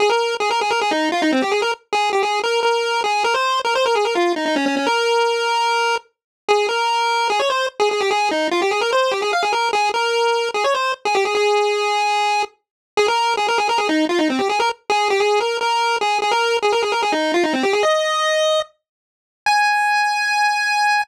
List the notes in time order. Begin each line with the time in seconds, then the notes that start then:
0.00 G#4
0.10 A#4
0.40 G#4
0.51 A#4
0.61 G#4
0.71 A#4
0.81 G#4
0.91 D#4
1.12 F4
1.22 D#4
1.32 C4
1.42 G4
1.52 G#4
1.62 A#4
1.93 G#4
2.13 G4
2.23 G#4
2.43 A#4
2.63 A#4
3.04 G#4
3.24 A#4
3.34 C5
3.65 A#4
3.75 C5
3.86 A#4
3.95 G#4
4.05 A#4
4.15 F4
4.36 D#4
4.46 D#4
4.56 C#4
4.66 C#4
4.77 C#4
4.86 A#4
6.49 G#4
6.69 A#4
7.30 G#4
7.40 C#5
7.50 C5
7.80 G#4
7.91 G#4
8.01 G4
8.11 G#4
8.31 D#4
8.51 F4
8.62 G4
8.71 G#4
8.81 A#4
8.93 C5
9.11 G4
9.22 G#4
9.33 F5
9.43 G#4
9.53 A#4
9.73 G#4
9.94 A#4
10.54 G#4
10.64 C#5
10.74 C5
11.05 G#4
11.15 G4
11.25 G#4
11.35 G#4
12.97 G#4
13.08 A#4
13.37 G#4
13.48 A#4
13.58 G#4
13.69 A#4
13.78 G#4
13.89 D#4
14.09 F4
14.19 D#4
14.30 C4
14.39 G4
14.49 G#4
14.60 A#4
14.90 G#4
15.10 G4
15.20 G#4
15.40 A#4
15.61 A#4
16.01 G#4
16.22 G#4
16.32 A#4
16.62 G#4
16.72 A#4
16.83 G#4
16.92 A#4
17.03 G#4
17.12 D#4
17.34 F4
17.44 D#4
17.53 C4
17.63 G4
17.73 G#4
17.83 D#5
19.46 G#5